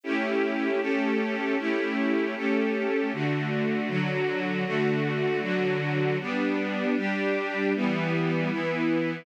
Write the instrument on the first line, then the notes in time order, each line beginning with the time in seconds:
string ensemble 1
0.04 A3 C#4 E4 G4
0.81 A3 C#4 G4 A4
1.58 A3 C#4 E4 G4
2.36 A3 C#4 G4 A4
3.12 D3 A3 F#4
3.88 D3 F#3 F#4
4.65 D3 A3 F#4
5.41 D3 F#3 F#4
6.20 G3 B3 D4
6.96 G3 D4 G4
7.75 E3 G3 B3
8.51 E3 B3 E4